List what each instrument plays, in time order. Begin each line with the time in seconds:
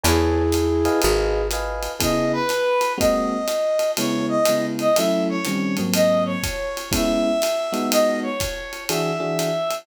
0.03 electric bass (finger) E2, flute E4 G#4, electric piano 1 B4 C#5 G#5 A5, ride
0.52 hi-hat pedal, ride
0.85 electric piano 1 B4 D#5 F5 G#5, ride
1.02 electric bass (finger) G#1, flute G#4, ride
1.51 electric piano 1 B4 D#5 F5 G#5, hi-hat pedal, ride
1.83 ride
2.00 electric piano 1 C#3 B3 E4 G#4, brass section D#5, kick, ride
2.33 brass section B4
2.49 hi-hat pedal, ride
2.81 ride
2.98 electric piano 1 G#3 A#3 C4 F#4, brass section D#5, kick, ride
3.48 hi-hat pedal, ride
3.79 ride
3.97 electric piano 1 C#3 G#3 B3 E4, brass section C#5, ride
4.28 brass section D#5
4.45 electric piano 1 C#3 G#3 B3 E4, hi-hat pedal, ride
4.79 brass section D#5, ride
4.96 electric piano 1 F#3 A3 C#4 E4, brass section E5, ride
5.29 brass section C#5
5.45 electric piano 1 D#3 G3 C4 C#4, hi-hat pedal, ride
5.77 electric piano 1 G#2 F#3 A#3 C4, ride
5.94 brass section D#5, ride
6.26 brass section C#5
6.43 kick, hi-hat pedal, ride
6.77 ride
6.91 electric piano 1 G#3 B3 C#4 E4, brass section E5, kick, ride
7.42 hi-hat pedal, ride
7.72 electric piano 1 G#3 B3 D#4 F#4, ride
7.91 brass section D#5, ride
8.22 brass section C#5
8.40 kick, hi-hat pedal, ride
8.73 ride
8.89 electric piano 1 E3 D4 F#4 G#4, brass section E5, ride
9.20 electric piano 1 E3 D4 F#4 G#4
9.39 hi-hat pedal, ride
9.71 ride